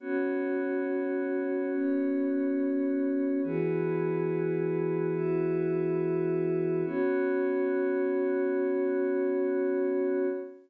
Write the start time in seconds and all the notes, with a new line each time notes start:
0.00 B3 C#4 F#4 C#5
1.72 B3 C#4 C#5
3.43 E3 B3 E4 F#4 G#4 B4
5.14 E4 F#4 B4 E5
6.85 B3 C#4 F#4 C#5